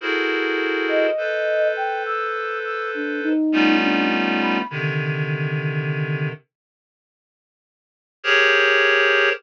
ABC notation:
X:1
M:4/4
L:1/16
Q:1/4=51
K:none
V:1 name="Clarinet"
[E_G_A=A_Bc]4 [A=Bc]8 [=G,A,B,_D_EF]4 | [C,D,_E,]6 z6 [G_A_Bc_d]4 |]
V:2 name="Flute"
z3 _e3 g =e'2 e' D _E2 D z b | z16 |]